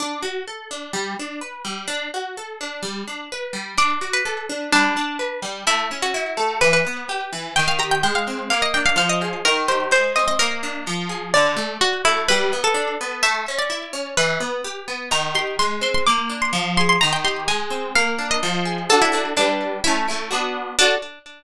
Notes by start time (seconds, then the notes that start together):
0.00 D4
0.22 F#4
0.48 A4
0.71 D4
0.93 G3
1.19 D4
1.41 B4
1.65 G3
1.88 D4
2.14 F#4
2.37 A4
2.61 D4
2.83 G3
3.07 D4
3.32 B4
3.53 G3
3.78 D4 D5
4.01 F#4
4.13 B4
4.25 A4
4.49 D4
4.72 G3 D4
4.97 D4
5.19 B4
5.42 G3
5.67 A3 E4
5.91 C#4
6.02 F#4
6.14 E4
6.37 A3
6.61 E3 B4
6.73 B4
6.87 B3
7.09 G4
7.33 E3
7.56 D#3 G5
7.68 F5
7.79 G4 A#5
7.91 G5
8.03 G#3 G5
8.15 F5
8.28 C4
8.50 A#3 F5
8.62 D#5
8.74 D4 G5
8.86 F5
8.96 F3 F5
9.09 D#5
9.22 G#4
9.45 D#3 A#4
9.68 G4 C5
9.91 G#3 C5
10.16 C4 D#5
10.28 D#5
10.39 A#3 A#4
10.63 D4
10.87 F3
11.09 G#4
11.34 D3 D5
11.56 A3
11.81 F#4
12.05 A3 E4
12.28 G3 B4
12.53 B3
12.64 A4
12.74 D4
13.01 B3
13.23 A3 E5
13.48 C#4
13.58 D5
13.70 E4
13.93 C#4
14.17 E3 B4
14.40 B3
14.64 G4
14.88 B3
15.11 D#3 A#5
15.35 G4 C6
15.59 G#3 C6
15.81 C4 C6
15.94 C6
16.06 A#3 D6
16.30 D4
16.42 C6
16.53 F3
16.77 G#4 C6
16.89 C6
17.01 D#3 A#5
17.13 G5
17.24 G4 C6
17.48 G#3 G#5
17.70 C4
17.95 A#3 F5
18.19 D4
18.31 D#5
18.43 F3
18.65 G#4
18.89 D4 F#4 A4
19.02 E4
19.12 D4 F#4 A4
19.37 G3 D4 B4
19.84 A3 C#4 E4
20.08 A3 C#4 E4
20.31 B3 D4 F#4
20.79 D4 F#4 A4